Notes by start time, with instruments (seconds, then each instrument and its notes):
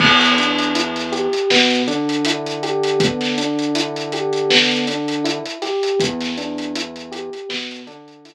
0.00 synth bass 1 E2, electric piano 1 B3, kick, crash
0.21 snare, closed hi-hat
0.37 electric piano 1 D4, snare, closed hi-hat
0.59 closed hi-hat
0.75 electric piano 1 E4, closed hi-hat
0.96 snare, closed hi-hat
1.12 electric piano 1 G4, closed hi-hat
1.33 closed hi-hat
1.50 synth bass 1 B2, electric piano 1 B3, snare
1.70 closed hi-hat
1.87 synth bass 1 D3, electric piano 1 D4, closed hi-hat
2.09 closed hi-hat
2.25 electric piano 1 E4, closed hi-hat
2.46 closed hi-hat
2.63 electric piano 1 G4, closed hi-hat
2.83 closed hi-hat
3.00 electric piano 1 B3, kick, closed hi-hat
3.21 snare, closed hi-hat
3.38 electric piano 1 D4, closed hi-hat
3.59 closed hi-hat
3.75 electric piano 1 E4, closed hi-hat
3.96 closed hi-hat
4.12 electric piano 1 G4, closed hi-hat
4.33 closed hi-hat
4.50 electric piano 1 B3, snare
4.71 closed hi-hat
4.87 electric piano 1 D4, closed hi-hat
5.08 closed hi-hat
5.24 electric piano 1 E4, closed hi-hat
5.46 closed hi-hat
5.62 electric piano 1 G4, snare, closed hi-hat
5.83 closed hi-hat
6.00 synth bass 1 E2, electric piano 1 B3, kick, closed hi-hat
6.21 snare, closed hi-hat
6.37 electric piano 1 D4, closed hi-hat
6.58 closed hi-hat
6.75 electric piano 1 E4, closed hi-hat
6.96 closed hi-hat
7.12 electric piano 1 G4, closed hi-hat
7.33 closed hi-hat
7.49 synth bass 1 B2, electric piano 1 B3, snare
7.71 closed hi-hat
7.87 synth bass 1 D3, electric piano 1 D4, closed hi-hat
8.08 closed hi-hat
8.25 electric piano 1 E4, closed hi-hat